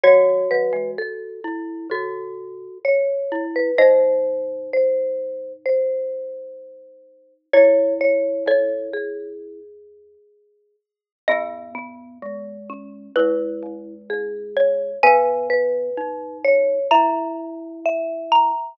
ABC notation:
X:1
M:4/4
L:1/16
Q:1/4=64
K:C#m
V:1 name="Xylophone"
c16 | d12 z4 | c4 c4 z8 | [K:G#m] d8 B6 c2 |
g8 a6 a2 |]
V:2 name="Marimba"
c2 B2 A4 A4 c3 B | ^B4 B4 B8 | c2 c2 A2 G8 z2 | [K:G#m] B,2 B,4 C2 E4 G4 |
B2 B4 c2 e4 e4 |]
V:3 name="Glockenspiel"
F6 E2 F4 z2 E2 | D16 | E10 z6 | [K:G#m] B,4 G,4 G,8 |
B,4 D4 E8 |]
V:4 name="Marimba" clef=bass
[D,F,]2 [D,F,] [E,G,] z4 [A,,C,]4 z4 | [G,,^B,,]16 | [F,,A,,]4 [C,,E,,]8 z4 | [K:G#m] [E,,G,,]8 [C,,E,,]2 [C,,E,,]2 [C,,E,,]2 [B,,,D,,]2 |
[G,,B,,]16 |]